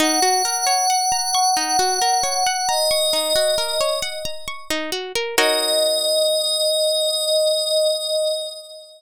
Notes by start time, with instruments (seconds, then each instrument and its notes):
0.00 pizzicato strings D#4, pad 5 (bowed) F#5
0.22 pizzicato strings F#4
0.45 pizzicato strings A#4
0.67 pizzicato strings C#5
0.90 pizzicato strings F#5
1.12 pizzicato strings A#5
1.35 pizzicato strings C#6
1.57 pizzicato strings D#4
1.79 pizzicato strings F#4
2.01 pizzicato strings A#4
2.23 pizzicato strings C#5
2.46 pizzicato strings F#5
2.68 pad 5 (bowed) D#5, pizzicato strings A#5
2.91 pizzicato strings C#6
3.13 pizzicato strings D#4
3.35 pizzicato strings F#4
3.58 pizzicato strings A#4
3.81 pizzicato strings C#5
4.02 pizzicato strings F#5
4.25 pizzicato strings A#5
4.48 pizzicato strings C#6
4.70 pizzicato strings D#4
4.92 pizzicato strings F#4
5.15 pizzicato strings A#4
5.37 pizzicato strings D#4 F#4 A#4 C#5, pad 5 (bowed) D#5